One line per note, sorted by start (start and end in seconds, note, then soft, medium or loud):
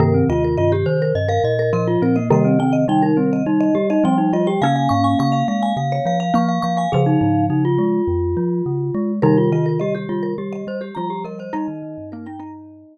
0.00 0.23 G2 medium
0.00 1.43 C3 medium
0.00 1.43 D#3 loud
0.00 0.13 A#3 medium
0.00 0.24 A#4 loud
0.14 0.28 C4 medium
0.29 0.56 D#2 medium
0.29 0.56 F4 medium
0.29 0.43 D#5 medium
0.44 0.58 A#4 medium
0.57 0.84 G2 medium
0.57 0.72 F4 medium
0.57 0.71 D#5 medium
0.72 0.98 G4 loud
0.72 0.86 G4 medium
0.86 1.12 D#3 medium
0.86 1.13 C5 medium
1.02 1.16 A#4 medium
1.15 1.39 G2 medium
1.15 1.29 D#5 medium
1.28 1.54 A#4 medium
1.28 1.43 F5 medium
1.44 1.72 A#2 medium
1.44 1.70 D#5 medium
1.59 1.73 A#4 medium
1.73 1.97 A#2 medium
1.73 2.20 F3 medium
1.73 1.88 A#4 medium
1.73 1.98 D#5 medium
1.87 2.01 F4 medium
2.02 2.30 A#2 medium
2.02 2.16 C4 medium
2.02 2.16 A#4 medium
2.16 2.30 A#3 medium
2.16 2.29 D#5 medium
2.30 3.86 C3 loud
2.30 3.86 D#3 loud
2.30 2.56 G3 medium
2.30 2.45 A#3 medium
2.30 2.59 D#5 medium
2.45 2.58 C4 medium
2.59 2.85 D#3 medium
2.59 2.84 C4 medium
2.59 2.73 G5 medium
2.73 2.86 D#5 medium
2.88 3.11 G3 medium
2.88 3.02 D#4 medium
2.88 3.03 G5 medium
3.02 3.17 D#4 medium
3.02 3.30 A#4 medium
3.17 3.42 G3 medium
3.17 3.43 C4 medium
3.33 3.47 D#5 medium
3.46 3.70 G3 medium
3.46 3.75 D#4 medium
3.60 3.88 D#5 medium
3.75 3.99 G3 medium
3.75 3.88 G4 medium
3.90 4.04 D#4 medium
3.90 4.04 D#5 medium
4.04 4.57 F3 medium
4.04 4.30 G3 medium
4.04 4.17 C4 medium
4.04 4.33 G5 medium
4.18 4.32 D#4 medium
4.33 4.60 G3 medium
4.33 4.47 F4 medium
4.33 4.47 D#5 medium
4.47 4.61 G4 medium
4.47 4.61 G5 medium
4.62 4.88 C#3 medium
4.62 6.29 A#3 medium
4.62 6.29 C#4 medium
4.62 4.75 F5 medium
4.62 4.89 G#5 medium
4.76 4.90 F5 medium
4.89 5.15 G#2 medium
4.89 5.19 F5 medium
4.89 5.03 C#6 medium
5.04 5.18 G#5 medium
5.19 5.43 C#3 medium
5.19 5.33 F5 medium
5.19 5.34 C#6 medium
5.32 5.59 F5 medium
5.32 5.47 F5 medium
5.48 5.73 G#3 medium
5.48 5.75 F5 medium
5.63 5.76 G#5 medium
5.77 6.00 C#3 medium
5.77 6.05 F5 medium
5.92 6.18 C#5 medium
6.06 6.31 F3 medium
6.06 6.19 F5 medium
6.20 6.34 F5 medium
6.34 6.59 F3 medium
6.34 6.89 A#3 medium
6.34 6.48 F5 medium
6.34 6.61 C#6 medium
6.49 6.62 F5 medium
6.62 6.86 F3 medium
6.62 6.77 F5 medium
6.62 6.76 C#6 medium
6.77 6.91 F5 medium
6.77 6.92 G#5 medium
6.92 7.17 C#3 medium
6.92 7.99 C#3 medium
6.92 7.99 F3 medium
6.92 7.06 G#4 medium
6.92 7.46 F5 medium
7.06 7.20 D#4 medium
7.21 7.49 G#2 medium
7.21 7.45 D#4 medium
7.50 7.78 C#3 medium
7.50 7.64 D#4 medium
7.65 9.12 F4 medium
7.78 8.02 G#3 medium
8.08 8.35 F2 medium
8.37 8.62 F3 medium
8.66 8.91 C#3 medium
8.94 9.20 G#3 medium
9.22 10.67 C3 medium
9.22 10.67 D#3 medium
9.22 9.50 G3 medium
9.22 9.37 D#4 medium
9.22 9.50 A#4 medium
9.37 9.51 F4 medium
9.52 9.78 D#3 medium
9.52 9.80 F4 medium
9.52 9.66 D#5 medium
9.66 9.80 A#4 medium
9.80 10.06 G3 medium
9.80 9.95 G4 medium
9.80 9.93 D#5 medium
9.95 10.19 G4 medium
9.95 10.09 G4 medium
10.09 10.34 G3 medium
10.09 10.34 F4 medium
10.23 10.36 A#4 medium
10.38 10.64 G3 medium
10.38 10.66 G4 medium
10.53 10.79 D#5 medium
10.67 10.91 G3 medium
10.67 10.82 C5 medium
10.81 10.95 G4 medium
10.95 11.51 F3 medium
10.95 11.24 G3 medium
10.95 11.10 F4 medium
10.95 11.22 A#5 medium
11.10 11.24 G4 medium
11.24 11.50 G3 medium
11.24 11.38 A#4 medium
11.24 11.39 D#5 medium
11.39 11.53 C5 medium
11.39 11.53 D#5 medium
11.53 11.68 G3 medium
11.53 11.67 D#4 loud
11.53 12.98 D#4 medium
11.53 12.09 D#5 loud
11.68 11.82 D#3 medium
11.82 11.96 D#3 medium
11.98 12.84 G2 medium
12.12 12.27 A#3 medium
12.12 12.26 A#4 medium
12.26 12.39 D#4 medium
12.26 12.40 G5 medium
12.40 12.98 D#4 medium
12.40 12.98 D#5 medium